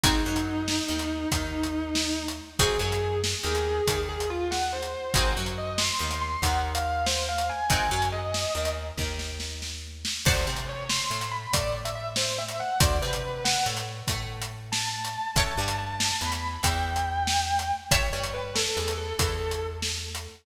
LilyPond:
<<
  \new Staff \with { instrumentName = "Distortion Guitar" } { \time 12/8 \key aes \major \tempo 4. = 94 ees'2. ees'2~ ees'8 r8 | aes'8 aes'4 r8 aes'4. aes'8 f'8 ges''8 c''4 | c''8 r8 ees''8 c'''4 c'''8 ges''8 r16 f''16 f''8 c''8 f''8 aes''8 | aes''4 ees''4. r2. r8 |
\key a \major c''8 r8 cis''8 c'''4 b''8 d''8 r16 e''16 e''8 c''8 e''8 fis''8 | d''8 b'4 fis''8 r2 r8 a''4. | a''4 a''4 b''4 g''2. | cis''8 cis''8 b'8 a'4 a'8 a'4 r2 | }
  \new Staff \with { instrumentName = "Acoustic Guitar (steel)" } { \time 12/8 \key aes \major <c' ees' ges' aes'>8 ges4. ees4 ees2. | <c' ees' ges' aes'>8 ges4. ees4 ees2. | <c' ees' ges' aes'>8 ges4. ees4 ees2. | <c' ees' ges' aes'>8 ges4. ees4 ees2. |
\key a \major <c'' d'' fis'' a''>8 c'4. a4 a2. | <c'' d'' fis'' a''>8 c'4. a4 a2. | <cis'' e'' g'' a''>8 g4. e4 e2. | <cis'' e'' g'' a''>8 g4. e4 e2. | }
  \new Staff \with { instrumentName = "Electric Bass (finger)" } { \clef bass \time 12/8 \key aes \major aes,,8 ges,4. ees,4 ees,2. | aes,,8 ges,4. ees,4 ees,2. | aes,,8 ges,4. ees,4 ees,2. | aes,,8 ges,4. ees,4 ees,2. |
\key a \major d,8 c4. a,4 a,2. | d,8 c4. a,4 a,2. | a,,8 g,4. e,4 e,2. | a,,8 g,4. e,4 e,2. | }
  \new DrumStaff \with { instrumentName = "Drums" } \drummode { \time 12/8 <hh bd>8. hh8. sn8. hh8. <hh bd>8. hh8. sn8. hh8. | <hh bd>8. hh8. sn8. hh8. <hh bd>8. hh8. sn8. hh8. | <hh bd>8. hh8. sn8. hh8. <hh bd>8. hh8. sn8. hh8. | <hh bd>8. hh8. sn8. hh8. <bd sn>8 sn8 sn8 sn4 sn8 |
<cymc bd>8. hh8. sn8. hh8. <hh bd>8. hh8. sn8. hh8. | <hh bd>8. hh8. sn8. hh8. <hh bd>8. hh8. sn8. hh8. | <hh bd>8. hh8. sn8. hh8. <hh bd>8. hh8. sn8. hh8. | <hh bd>8. hh8. sn8. hh8. <hh bd>8. hh8. sn8. hh8. | }
>>